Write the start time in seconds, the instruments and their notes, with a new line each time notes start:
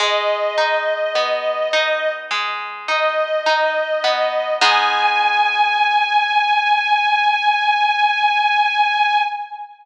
0.00 orchestral harp G#3, string ensemble 1 D#5
0.58 orchestral harp D#4
1.15 orchestral harp B3
1.73 orchestral harp D#4
2.31 orchestral harp G#3
2.88 orchestral harp D#4, string ensemble 1 D#5
3.46 orchestral harp D#4
4.04 orchestral harp B3
4.61 orchestral harp G#3 B3 D#4, string ensemble 1 G#5